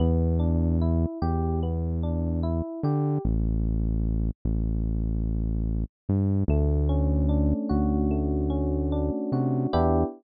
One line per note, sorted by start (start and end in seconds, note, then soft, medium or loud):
0.00 1.06 E2 loud
0.00 0.36 B3 medium
0.40 0.77 D4 medium
0.82 1.19 E4 medium
1.22 2.62 E2 medium
1.22 1.59 G4 medium
1.63 2.00 B3 medium
2.03 2.40 D4 medium
2.43 2.80 E4 medium
2.83 3.19 D3 loud
2.83 3.21 G4 medium
3.25 4.31 A1 loud
4.45 5.85 A1 loud
6.09 6.44 G2 loud
6.48 7.54 D2 loud
6.48 8.10 A3 medium
6.89 8.49 C#4 medium
7.29 8.92 D4 medium
7.69 9.11 D2 medium
7.69 9.32 F#4 medium
8.11 9.66 A3 medium
8.50 9.66 C#4 medium
8.92 9.70 D4 medium
9.32 9.67 C3 medium
9.32 9.71 F#4 medium
9.73 10.04 E2 loud
9.73 10.03 B3 medium
9.73 10.03 D4 loud
9.73 10.03 E4 loud
9.73 10.03 G4 loud